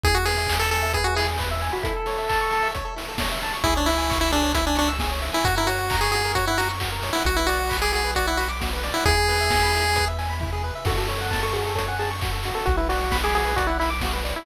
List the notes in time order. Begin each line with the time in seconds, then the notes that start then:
0.04 E2 E4 G#4, kick, closed hi-hat
0.15 F#4 G#4
0.25 G#4 B4, open hi-hat
0.37 E5
0.47 G#5, kick, clap
0.59 A4 B5
0.71 A4 G#5, open hi-hat
0.82 E5
0.93 G#4 B4, kick, closed hi-hat
1.04 F#4 G#4
1.16 E4 G#4, open hi-hat
1.28 G#4
1.38 B4, kick, clap
1.51 E5
1.61 G#5, open hi-hat
1.72 F#4 B5
1.83 E4 A4, kick, closed hi-hat
1.96 A4
2.06 C#5, open hi-hat
2.18 E5
2.29 A5, kick, clap
2.41 C#6
2.51 A5, open hi-hat
2.63 E5
2.74 C#5, kick, closed hi-hat
2.85 A4
2.96 E4, open hi-hat
3.08 A4
3.18 C#5, kick, snare
3.32 E5
3.42 A5, open hi-hat
3.54 C#6
3.64 C#2 E4 G#4, kick, closed hi-hat
3.76 D4 C#5
3.86 E4 E5, open hi-hat
3.98 G#5
4.10 C#6, kick, clap
4.21 E4 E6
4.31 D4 G#4, open hi-hat
4.43 C#5
4.54 E4 E5, kick, closed hi-hat
4.66 D4 G#5
4.75 D4 C#6, open hi-hat
4.88 E6
4.99 G#4, kick, snare
5.11 C#5
5.22 E5, open hi-hat
5.33 E4 G#5
5.44 F#2 F#4, kick, closed hi-hat
5.56 E4 A#4
5.67 F#4 C#5, open hi-hat
5.79 F#5
5.90 A#5, kick, clap
6.01 G#4 C#6
6.12 F#4 G#4, open hi-hat
6.25 A#4
6.35 F#4 C#5, kick, closed hi-hat
6.47 E4 F#5
6.57 F#4 A#5, open hi-hat
6.69 C#6
6.80 F#4, kick, clap
6.92 A#4
7.02 C#5, open hi-hat
7.13 E4 F#5
7.25 B1 F#4, kick, closed hi-hat
7.36 E4 B4
7.47 F#4 D5, open hi-hat
7.59 F#5
7.70 B5, kick, clap
7.82 G#4 D6
7.93 F#4 G#4, open hi-hat
8.04 B4
8.15 F#4 D5, kick, closed hi-hat
8.27 E4 F#5
8.37 F#4 B5, open hi-hat
8.49 D6
8.60 F#4, kick, snare
8.73 B4
8.83 D5, open hi-hat
8.94 E4 F#5
9.06 E2 E4 G#4, kick, closed hi-hat
9.18 G#4
9.28 B4, open hi-hat
9.41 E5
9.50 G#5, kick, snare
9.63 B5
9.74 E4, open hi-hat
9.85 G#4
9.96 B4, kick, closed hi-hat
10.08 E5
10.19 G#5, open hi-hat
10.30 B5
10.40 E4, kick, floor tom
10.53 G#4
10.64 B4
10.75 E5
10.85 F#2 F#4 A4, kick, crash
10.98 F#4 A4
11.08 A4 C#5, open hi-hat
11.21 F#5
11.31 A5, kick, snare
11.43 A4 C#6
11.53 F#4 G#4, open hi-hat
11.66 A4
11.75 A4 C#5, kick, closed hi-hat
11.88 F#5 G#5
11.99 G#4 A5, open hi-hat
12.11 C#6
12.21 F#4, kick, clap
12.33 A4
12.43 F#4, open hi-hat
12.55 A4
12.66 B1 F#4, kick, closed hi-hat
12.77 E4 B4
12.89 F#4 D5, open hi-hat
13.00 F#5
13.11 B5, kick, snare
13.23 G#4 D6
13.34 F#4 G#4, open hi-hat
13.45 B4
13.56 F#4 D5, kick, closed hi-hat
13.67 E4 F#5
13.80 E4 B5, open hi-hat
13.90 D6
14.01 F#4, kick, snare
14.13 B4
14.25 D5, open hi-hat
14.36 E4 F#5